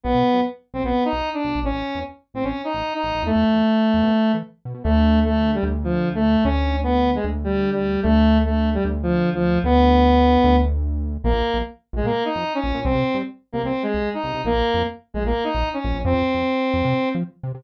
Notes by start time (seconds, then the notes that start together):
0.04 B1 B3
0.14 B2
0.34 F#2
0.74 B1 C4
0.84 B1 B3
1.05 D#4
1.13 B1
1.34 D4
1.44 B1
1.55 B1
1.64 A1 C#4
1.74 A1
1.95 E2
2.34 A1 C4
2.44 A1 C#4
2.64 D#4
2.74 A1
2.94 D#4
3.03 A1
3.15 A1
3.23 E2 A3
3.35 E2
3.54 E2
3.94 E2
4.03 B2
4.34 E3
4.65 B2
4.74 B2
4.84 D2 A3
5.24 A3
5.54 G3
5.63 D2
5.84 F3
6.15 A3
6.44 D2 C#4
6.83 B3
7.15 G#3
7.24 D2
7.44 G3
7.72 G3
8.03 D2 A3
8.45 A3
8.74 G3
8.85 D2
9.03 F3
9.34 F3
9.64 D2 B3
10.44 D2
11.24 A#1 A#3
11.34 A#1
11.54 A#1
11.93 A#1 G#3
12.03 A#2 A#3
12.25 D#4
12.35 F2
12.54 C#4
12.64 A#1
12.74 A#2
12.84 C2 C4
12.95 C3
13.14 G2
13.53 C2 A#3
13.64 C2 C4
13.83 G#3
13.94 C2
14.14 D#4
14.24 C2
14.34 C2
14.44 A#1 A#3
14.54 A#1
14.74 F2
15.14 A#1 G#3
15.24 A#1 A#3
15.44 D#4
15.55 A#1
15.73 C#4
15.84 A#1
15.94 A#1
16.05 F2 C4
16.14 F2
16.34 F2
16.74 F2
16.85 C3
17.15 F3
17.43 C3
17.55 C3